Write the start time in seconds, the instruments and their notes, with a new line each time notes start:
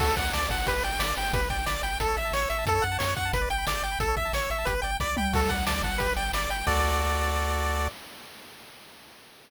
0.00 synth bass 1 D2, lead 1 (square) F#4 A4, kick, crash
0.08 lead 1 (square) A4
0.17 synth bass 1 D2, lead 1 (square) D5 F#5, kick, closed hi-hat
0.25 lead 1 (square) F#5
0.33 synth bass 1 D2, lead 1 (square) D5 A5, snare
0.42 lead 1 (square) D6
0.49 synth bass 1 G1, lead 1 (square) F#5 A5, kick, closed hi-hat
0.58 lead 1 (square) F#5
0.67 lead 1 (square) G4 B4, kick, closed hi-hat
0.75 lead 1 (square) B4
0.83 synth bass 1 G1, lead 1 (square) D5 G5, closed hi-hat
0.92 lead 1 (square) G5
0.99 synth bass 1 G1, lead 1 (square) D5 B5, snare
1.08 lead 1 (square) D6
1.17 synth bass 1 G1, lead 1 (square) G5 B5, open hi-hat
1.25 lead 1 (square) G5
1.33 synth bass 1 G1, lead 1 (square) G4 B4, kick, closed hi-hat
1.42 lead 1 (square) B4
1.50 synth bass 1 G1, lead 1 (square) D5 G5, kick, closed hi-hat
1.58 lead 1 (square) G5
1.66 synth bass 1 G1, lead 1 (square) D5 B5, snare
1.75 lead 1 (square) D6
1.83 synth bass 1 G1, lead 1 (square) G5 B5, closed hi-hat
1.92 lead 1 (square) G5
2.00 synth bass 1 A1, lead 1 (square) A4, kick, closed hi-hat
2.08 lead 1 (square) C#5
2.17 synth bass 1 A1, lead 1 (square) E5, closed hi-hat
2.25 lead 1 (square) A5
2.32 synth bass 1 A1, lead 1 (square) C#5 C#6, snare
2.42 lead 1 (square) E6
2.49 synth bass 1 A1, lead 1 (square) E5 C#6, closed hi-hat
2.58 lead 1 (square) A5
2.66 synth bass 1 F#2, lead 1 (square) A4, kick, closed hi-hat
2.75 lead 1 (square) C#5
2.82 synth bass 1 F#2, lead 1 (square) F#5, closed hi-hat
2.92 lead 1 (square) A5
2.99 synth bass 1 F#2, lead 1 (square) C#5 C#6, snare
3.08 lead 1 (square) F#6
3.16 synth bass 1 F#2, lead 1 (square) F#5 C#6, kick, closed hi-hat
3.25 lead 1 (square) A5
3.33 synth bass 1 G1, lead 1 (square) B4, kick, closed hi-hat
3.41 lead 1 (square) D5
3.50 synth bass 1 G1, lead 1 (square) G5, closed hi-hat
3.58 lead 1 (square) B5
3.66 synth bass 1 G1, lead 1 (square) D5 D6, snare
3.75 lead 1 (square) G6
3.82 synth bass 1 G1, lead 1 (square) G5 D6, closed hi-hat
3.92 lead 1 (square) B5
3.99 synth bass 1 A1, lead 1 (square) A4, kick, closed hi-hat
4.08 lead 1 (square) C#5
4.17 synth bass 1 A1, lead 1 (square) E5, kick, closed hi-hat
4.25 lead 1 (square) A5
4.33 synth bass 1 A1, lead 1 (square) C#5 C#6, snare
4.42 lead 1 (square) E6
4.50 synth bass 1 A1, lead 1 (square) E5 C#6, closed hi-hat
4.58 lead 1 (square) A5
4.65 synth bass 1 G1, lead 1 (square) G4 B4, kick, closed hi-hat
4.75 lead 1 (square) B4
4.82 synth bass 1 G1, lead 1 (square) D5 G5, closed hi-hat
4.92 lead 1 (square) G5
5.00 synth bass 1 C2, lead 1 (square) D5 B5, kick, snare
5.08 lead 1 (square) D6
5.17 synth bass 1 C#2, lead 1 (square) G5 B5, mid tom
5.25 lead 1 (square) G5
5.33 synth bass 1 D2, lead 1 (square) F#4 A4, kick, crash
5.42 lead 1 (square) A4
5.49 synth bass 1 D2, lead 1 (square) D5 F#5, kick, closed hi-hat
5.58 lead 1 (square) F#5
5.66 synth bass 1 D2, lead 1 (square) D5 A5, snare
5.75 lead 1 (square) D6
5.82 synth bass 1 G1, lead 1 (square) F#5 A5, kick, closed hi-hat
5.92 lead 1 (square) F#5
5.98 lead 1 (square) G4 B4, kick, closed hi-hat
6.09 lead 1 (square) B4
6.16 synth bass 1 G1, lead 1 (square) D5 G5, closed hi-hat
6.25 lead 1 (square) G5
6.33 synth bass 1 G1, lead 1 (square) D5 B5, snare
6.42 lead 1 (square) D6
6.49 synth bass 1 G1, lead 1 (square) G5 B5, closed hi-hat
6.58 lead 1 (square) G5
6.67 synth bass 1 D2, lead 1 (square) F#4 A4 D5, kick, crash